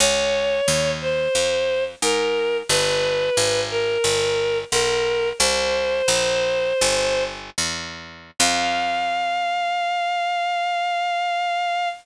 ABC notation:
X:1
M:4/4
L:1/8
Q:1/4=89
K:Fm
V:1 name="Violin"
d3 c3 B2 | =B3 _B3 B2 | "^rit." c6 z2 | f8 |]
V:2 name="Harpsichord" clef=bass
D,,2 E,,2 F,,2 A,,2 | G,,,2 A,,,2 G,,,2 =B,,,2 | "^rit." C,,2 B,,,2 G,,,2 =E,,2 | F,,8 |]